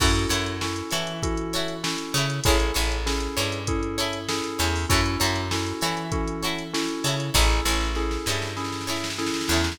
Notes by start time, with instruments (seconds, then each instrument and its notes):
0.00 electric bass (finger) F#2, electric piano 2 C#4 E4 F#4 A4, pizzicato strings E4 F#4 A4 C#5, kick, crash
0.15 closed hi-hat
0.29 electric bass (finger) F#2, pizzicato strings E4 F#4 A4 C#5, closed hi-hat
0.46 closed hi-hat
0.61 electric piano 2 C#4 E4 F#4 A4, snare
0.76 closed hi-hat
0.91 electric bass (finger) E3, pizzicato strings E4 F#4 A4 C#5, closed hi-hat
1.07 closed hi-hat
1.22 electric piano 2 C#4 E4 F#4 A4, kick, closed hi-hat
1.37 closed hi-hat
1.53 pizzicato strings E4 F#4 A4 C#5, snare, closed hi-hat
1.68 closed hi-hat
1.83 electric piano 2 C#4 E4 F#4 A4, snare
1.98 closed hi-hat
2.14 electric bass (finger) C#3, pizzicato strings E4 F#4 A4 C#5, closed hi-hat
2.29 snare, closed hi-hat
2.44 electric bass (finger) A1, electric piano 2 C#4 E4 G#4 A4, pizzicato strings G#4 A4 C#5, kick, closed hi-hat
2.48 pizzicato strings E4
2.60 closed hi-hat
2.74 electric bass (finger) A1, pizzicato strings E4 G#4 A4 C#5, closed hi-hat
2.91 snare, closed hi-hat
3.06 electric piano 2 C#4 E4 G#4 A4, snare
3.20 snare, closed hi-hat
3.37 electric bass (finger) G2, pizzicato strings E4 G#4 A4 C#5, closed hi-hat
3.52 closed hi-hat
3.67 electric piano 2 C#4 E4 G#4 A4, kick, closed hi-hat
3.83 closed hi-hat
3.98 pizzicato strings E4 G#4 A4 C#5, closed hi-hat
4.13 closed hi-hat
4.29 electric piano 2 C#4 E4 G#4 A4, snare
4.44 closed hi-hat
4.59 electric bass (finger) E2, pizzicato strings E4 G#4 A4 C#5, snare, closed hi-hat
4.76 open hi-hat
4.89 electric bass (finger) F#2, electric piano 2 C#4 E4 F#4 A4, pizzicato strings E4 F#4 A4 C#5, kick, closed hi-hat
5.06 closed hi-hat
5.20 electric bass (finger) F#2, pizzicato strings E4 F#4 A4 C#5, closed hi-hat
5.36 snare, closed hi-hat
5.51 electric piano 2 C#4 E4 F#4 A4, snare
5.66 closed hi-hat
5.81 electric bass (finger) E3, pizzicato strings E4 F#4 A4 C#5, closed hi-hat
5.97 closed hi-hat
6.12 electric piano 2 C#4 E4 F#4 A4, kick, closed hi-hat
6.28 closed hi-hat
6.42 pizzicato strings E4 F#4 A4 C#5, closed hi-hat
6.59 closed hi-hat
6.73 electric piano 2 C#4 E4 F#4 A4, snare
6.88 closed hi-hat
7.04 electric bass (finger) C#3, pizzicato strings E4 F#4 A4 C#5, closed hi-hat
7.19 snare, closed hi-hat
7.34 electric bass (finger) A1, electric piano 2 C#4 E4 G#4 A4, pizzicato strings E4 G#4 A4 C#5, kick, snare
7.50 snare
7.65 electric bass (finger) A1, pizzicato strings E4 G#4 A4 C#5, snare
7.80 snare
7.95 electric piano 2 C#4 E4 G#4 A4, snare
8.11 snare
8.26 electric bass (finger) G2, pizzicato strings E4 G#4 A4 C#5, snare
8.42 snare
8.57 electric piano 2 C#4 E4 G#4 A4, snare
8.64 snare
8.72 snare
8.81 snare
8.87 pizzicato strings E4 G#4 A4 C#5, snare
8.96 snare
9.04 snare
9.10 snare
9.18 electric piano 2 C#4 E4 G#4 A4, snare
9.26 snare
9.34 snare
9.41 snare
9.48 electric bass (finger) E2, pizzicato strings G#4 A4 C#5, snare
9.52 pizzicato strings E4
9.57 snare
9.64 snare
9.72 snare